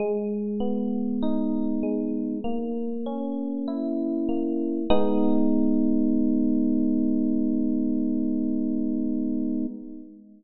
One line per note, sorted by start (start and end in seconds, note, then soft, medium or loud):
0.00 1.83 G#3 medium
0.60 2.35 B3 medium
1.22 2.39 D#4 medium
1.83 2.41 G#3 medium
2.44 4.28 A#3 medium
3.06 4.81 C#4 medium
3.68 4.84 E4 medium
4.29 4.87 A#3 medium
4.90 9.66 G#3 loud
4.90 9.66 B3 loud
4.90 9.66 D#4 loud